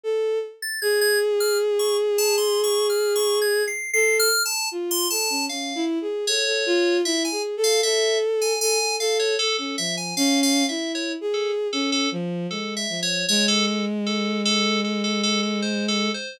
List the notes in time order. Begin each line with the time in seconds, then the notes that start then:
0.04 A4
0.62 A6
0.82 G#4 G#6
1.01 G#6
1.40 F6
1.79 C#6
2.18 A5
2.38 C6
2.64 C#6
2.90 F6
3.16 C#6
3.42 G#6
3.68 C7
3.94 A4 C7
4.19 F6
4.45 A5
4.71 F4
4.91 C6
5.10 A4 A5
5.30 C#4
5.49 C#4 F5
5.75 E4
6.01 G#4
6.27 A4 C#5
6.47 A4
6.66 F4
7.05 E4 E5
7.25 G#5
7.32 G#4
7.57 A4
7.64 F5
7.83 A4 E5
8.42 G#5
8.61 A4 G#5
8.80 A4
9.00 A4 F5
9.19 C#5
9.39 A4
9.58 C#4 A4
9.78 F3 E5
9.97 G#5
10.17 C#4 F5
10.43 F5
10.69 E4 E5
10.95 C#5
11.21 G#4
11.34 A4
11.73 C#4 A4
11.92 A4
12.12 F3
12.50 G#3 A4
12.77 E5
12.89 F3
13.03 C#5
13.29 G#3 C#5
13.48 A4
13.68 A4
14.06 A4
14.45 A4
14.84 A4
15.04 A4
15.23 A4
15.43 A4
15.62 C5
15.88 A4
16.14 C5